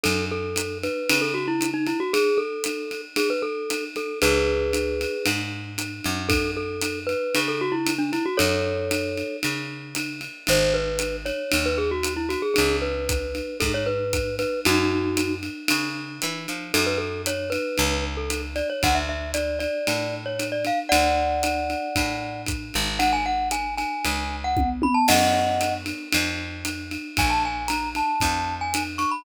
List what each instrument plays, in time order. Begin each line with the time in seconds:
0.03 electric bass (finger) F#2, glockenspiel A4, ride
0.31 glockenspiel A4
0.56 hi-hat pedal, ride
0.83 glockenspiel B4, ride
1.09 electric bass (finger) C#3, ride
1.21 glockenspiel A4
1.34 glockenspiel F#4
1.47 glockenspiel E4
1.61 hi-hat pedal, ride
1.74 glockenspiel D#4
1.87 glockenspiel E4, ride
2.00 glockenspiel F#4
2.13 glockenspiel G#4, ride
2.37 glockenspiel A4
2.64 hi-hat pedal, ride
2.91 ride
3.16 glockenspiel G#4, ride
3.30 glockenspiel B4
3.42 glockenspiel A4
3.70 hi-hat pedal, ride
3.96 glockenspiel A4, ride
4.22 electric bass (finger) C#2, glockenspiel G#4 B4, ride
4.73 hi-hat pedal, ride
5.01 ride
5.26 electric bass (finger) G#2, ride
5.78 hi-hat pedal, ride
6.04 electric bass (finger) F#2, ride
6.29 glockenspiel A4, kick, ride
6.57 glockenspiel A4
6.81 hi-hat pedal, ride
7.07 glockenspiel B4, ride
7.35 electric bass (finger) C#3, ride
7.48 glockenspiel A4
7.61 glockenspiel F#4
7.72 glockenspiel E4
7.87 hi-hat pedal, ride
7.98 glockenspiel D4
8.13 glockenspiel E4, ride
8.26 glockenspiel F#4
8.37 electric bass (finger) F#2, glockenspiel A4 C#5, ride
8.91 hi-hat pedal, ride
9.17 ride
9.43 electric bass (finger) C#3, ride
9.95 hi-hat pedal, ride
10.21 ride
10.47 electric bass (finger) G#1, glockenspiel C5, ride
10.74 glockenspiel B4
10.99 hi-hat pedal, ride
11.25 glockenspiel C#5, ride
11.52 electric bass (finger) D#2, ride
11.66 glockenspiel B4
11.78 glockenspiel G#4
11.91 glockenspiel F#4
12.03 hi-hat pedal, ride
12.16 glockenspiel E4
12.29 glockenspiel F#4, ride
12.42 glockenspiel G#4
12.54 electric bass (finger) C#2, glockenspiel G#4, ride
12.82 glockenspiel B4
13.09 kick, hi-hat pedal, ride
13.35 ride
13.60 electric bass (finger) G#2, glockenspiel A4, kick, ride
13.74 glockenspiel C#5
13.86 glockenspiel B4
14.13 kick, hi-hat pedal, ride
14.39 glockenspiel B4, ride
14.65 electric bass (finger) F#2, glockenspiel D#4 F#4, ride
15.17 hi-hat pedal, ride
15.43 ride
15.68 electric bass (finger) C#3, ride
16.22 electric bass (finger) E3, hi-hat pedal, ride
16.48 electric bass (finger) F3, ride
16.74 electric bass (finger) F#2, glockenspiel A4, ride
16.86 glockenspiel B4
16.98 glockenspiel A4
17.26 glockenspiel C#5, hi-hat pedal, ride
17.50 glockenspiel B4, ride
17.78 electric bass (finger) C#2, ride
18.17 glockenspiel A4
18.30 hi-hat pedal, ride
18.56 glockenspiel D5, ride
18.70 glockenspiel C#5
18.83 electric bass (finger) D2, glockenspiel F#5, kick, ride
18.95 glockenspiel E5
19.09 glockenspiel E5
19.34 glockenspiel D5, hi-hat pedal, ride
19.59 glockenspiel D5, ride
19.87 electric bass (finger) A2, ride
20.26 glockenspiel C#5
20.39 hi-hat pedal, ride
20.52 glockenspiel D5
20.65 glockenspiel F5, ride
20.89 electric bass (finger) D2, glockenspiel D5 F#5, ride
21.43 hi-hat pedal, ride
21.70 ride
21.96 electric bass (finger) A2, kick, ride
22.46 kick, hi-hat pedal, ride
22.74 electric bass (finger) G#1, ride
22.99 glockenspiel F#5, ride
23.13 glockenspiel G#5
23.26 glockenspiel F#5
23.51 glockenspiel G#5, hi-hat pedal, ride
23.77 glockenspiel G#5, ride
24.05 electric bass (finger) C#2, ride
24.44 glockenspiel F#5
24.57 kick, high tom
24.82 glockenspiel B5, high tom
24.94 glockenspiel A5
25.08 electric bass (finger) F#2, glockenspiel D#5 F#5, crash, ride
25.61 hi-hat pedal, ride
25.86 ride
26.12 electric bass (finger) F2, ride
26.65 hi-hat pedal, ride
26.91 ride
27.17 electric bass (finger) A#1, glockenspiel G#5, kick, ride
27.30 glockenspiel A5
27.45 glockenspiel G#5
27.68 glockenspiel A#5, hi-hat pedal, ride
27.95 glockenspiel A5, ride
28.20 electric bass (finger) F2, kick, ride
28.61 glockenspiel G#5
28.74 hi-hat pedal, ride
28.98 glockenspiel C#6, ride
29.11 glockenspiel B5